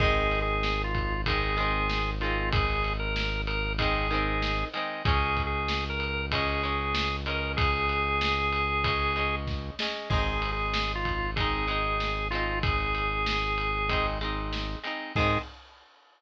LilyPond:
<<
  \new Staff \with { instrumentName = "Drawbar Organ" } { \time 4/4 \key aes \mixolydian \tempo 4 = 95 \tuplet 3/2 { aes'4 aes'4 f'4 } aes'4. f'8 | aes'8. bes'8. bes'8 aes'4. r8 | \tuplet 3/2 { aes'4 aes'4 bes'4 } aes'4. bes'8 | aes'2. r4 |
\tuplet 3/2 { aes'4 aes'4 f'4 } aes'4. f'8 | aes'2~ aes'8 r4. | aes'4 r2. | }
  \new Staff \with { instrumentName = "Overdriven Guitar" } { \time 4/4 \key aes \mixolydian <ees aes c'>2 <ees aes c'>8 <ees aes c'>4 <ees aes c'>8~ | <ees aes c'>2 <ees aes c'>8 <ees aes c'>4 <ees aes c'>8 | <aes des'>2 <aes des'>8 <aes des'>4 <aes des'>8~ | <aes des'>2 <aes des'>8 <aes des'>4 <aes des'>8 |
<aes c' ees'>2 <aes c' ees'>8 <aes c' ees'>4 <aes c' ees'>8~ | <aes c' ees'>2 <aes c' ees'>8 <aes c' ees'>4 <aes c' ees'>8 | <ees aes c'>4 r2. | }
  \new Staff \with { instrumentName = "Synth Bass 1" } { \clef bass \time 4/4 \key aes \mixolydian aes,,1~ | aes,,1 | des,1~ | des,1 |
aes,,1~ | aes,,1 | aes,4 r2. | }
  \new DrumStaff \with { instrumentName = "Drums" } \drummode { \time 4/4 <cymc bd>8 cymr8 sn8 <bd cymr>8 <bd cymr>8 cymr8 sn8 cymr8 | <bd cymr>8 cymr8 sn8 cymr8 <bd cymr>8 cymr8 sn8 cymr8 | <bd cymr>8 <bd cymr>8 sn8 cymr8 <bd cymr>8 cymr8 sn8 cymr8 | <bd cymr>8 cymr8 sn8 cymr8 <bd cymr>8 cymr8 <bd sn>8 sn8 |
<cymc bd>8 cymr8 sn8 <bd cymr>8 <bd cymr>8 cymr8 sn8 cymr8 | <bd cymr>8 cymr8 sn8 cymr8 <bd cymr>8 cymr8 sn8 cymr8 | <cymc bd>4 r4 r4 r4 | }
>>